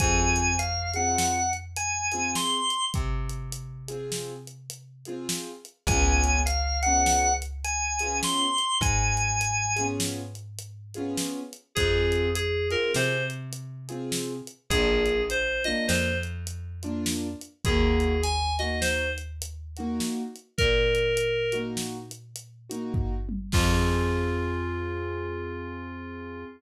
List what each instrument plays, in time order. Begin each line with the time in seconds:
0.00 electric bass (finger) F2, acoustic grand piano C4 F4 G#4, drawbar organ G#5, kick, closed hi-hat
0.36 closed hi-hat
0.59 drawbar organ F5, closed hi-hat
0.94 acoustic grand piano C4 F4 G#4, drawbar organ F#5, closed hi-hat
1.18 snare
1.53 closed hi-hat
1.76 drawbar organ G#5, closed hi-hat
2.12 acoustic grand piano C4 F4 G#4, closed hi-hat
2.35 drawbar organ C6, snare
2.70 closed hi-hat
2.94 electric bass (finger) C3, kick, closed hi-hat
3.29 closed hi-hat
3.52 closed hi-hat
3.88 acoustic grand piano C4 F4 G#4, closed hi-hat
4.12 snare
4.47 closed hi-hat
4.70 closed hi-hat
5.05 acoustic grand piano C4 F4 G#4, closed hi-hat
5.29 snare
5.65 closed hi-hat
5.87 electric bass (finger) C#2, acoustic grand piano F4 G#4, drawbar organ G#5, kick, closed hi-hat
5.91 acoustic grand piano B3 C#4
6.24 closed hi-hat
6.46 drawbar organ F5, closed hi-hat
6.82 acoustic grand piano F4 G#4, drawbar organ F#5, closed hi-hat
6.87 acoustic grand piano B3 C#4
7.06 snare
7.42 closed hi-hat
7.64 drawbar organ G#5, closed hi-hat
7.99 acoustic grand piano C#4 F4 G#4, closed hi-hat
8.05 acoustic grand piano B3
8.23 drawbar organ C6, snare
8.58 closed hi-hat
8.81 electric bass (finger) G#2, drawbar organ G#5, kick, closed hi-hat
9.17 closed hi-hat
9.41 closed hi-hat
9.76 acoustic grand piano C#4 F4 G#4, closed hi-hat
9.80 acoustic grand piano B3
10.00 snare
10.35 closed hi-hat
10.59 closed hi-hat
10.94 acoustic grand piano C#4 F4 G#4, closed hi-hat
10.99 acoustic grand piano B3
11.17 snare
11.53 closed hi-hat
11.75 electric bass (finger) F2, acoustic grand piano C4 F4 G#4, electric piano 2 G#4, kick, closed hi-hat
12.12 closed hi-hat
12.35 electric piano 2 G#4, closed hi-hat
12.71 acoustic grand piano C4 F4 G#4, electric piano 2 A#4, closed hi-hat
12.94 electric bass (finger) C3, electric piano 2 C5, snare
13.30 closed hi-hat
13.53 closed hi-hat
13.89 acoustic grand piano C4 F4 G#4, closed hi-hat
14.12 snare
14.47 closed hi-hat
14.70 electric bass (finger) A#1, acoustic grand piano A#3 D4 F4, electric piano 2 G#4, kick, closed hi-hat
15.06 closed hi-hat
15.30 electric piano 2 C5, closed hi-hat
15.64 acoustic grand piano A#3 D4 F4, electric piano 2 D#5, closed hi-hat
15.87 electric bass (finger) F2, electric piano 2 C5, snare
16.23 closed hi-hat
16.47 closed hi-hat
16.83 acoustic grand piano A#3 D4 F4, closed hi-hat
17.06 snare
17.41 closed hi-hat
17.65 electric bass (finger) D#2, acoustic grand piano A#3 D#4 F#4, electric piano 2 G#4, kick, closed hi-hat
18.00 closed hi-hat
18.23 electric piano 2 G#5, closed hi-hat
18.59 acoustic grand piano A#3 D#4 F#4, electric piano 2 D#5, closed hi-hat
18.81 electric piano 2 C5, snare
19.18 closed hi-hat
19.42 closed hi-hat
19.77 acoustic grand piano A#3 D#4 F#4, closed hi-hat
20.00 snare
20.36 closed hi-hat
20.58 electric bass (finger) A#2, electric piano 2 A#4, kick, closed hi-hat
20.95 closed hi-hat
21.17 closed hi-hat
21.52 acoustic grand piano A#3 D#4 F#4, closed hi-hat
21.77 snare
22.11 closed hi-hat
22.36 closed hi-hat
22.69 acoustic grand piano A#3 D#4 F#4, closed hi-hat
22.94 kick, floor tom
23.29 high tom
23.52 electric bass (finger) F2, electric piano 2 F4, acoustic grand piano F4 G#4, kick, crash
23.56 acoustic grand piano C4